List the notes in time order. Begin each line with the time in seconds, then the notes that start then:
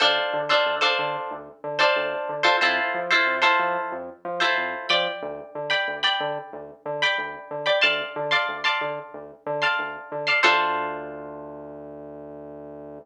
0.00 D2 D4 F4 A4 C5
0.33 D3
0.49 D4 F4 A4 C5
0.66 D2
0.81 D4 F4 A4 C5
0.99 D3
1.31 D2
1.64 D3
1.79 D4 F4 A4 C5
1.96 D2
2.29 D3
2.43 D4 F4 A4 C5
2.61 F2 E4 F4 A4 C5
2.94 F3
3.11 E4 F4 A4 C5
3.27 F2
3.42 E4 F4 A4 C5
3.59 F3
3.92 F2
4.25 F3
4.40 E4 F4 A4 C5
4.57 F2
4.89 F3 D5 G5 B5
5.22 D2
5.55 D3
5.70 D5 G5 B5
5.88 D2
6.03 D5 G5 B5
6.20 D3
6.53 D2
6.85 D3
7.02 D5 G5 B5
7.18 D2
7.51 D3
7.66 D5 G5 B5
7.81 D2 D5 F5 A5 C6
8.16 D3
8.31 D5 F5 A5 C6
8.49 D2
8.64 D5 F5 A5 C6
8.81 D3
9.14 D2
9.46 D3
9.62 D5 F5 A5 C6
9.79 D2
10.12 D3
10.27 D5 F5 A5 C6
10.43 D2 D4 F4 A4 C5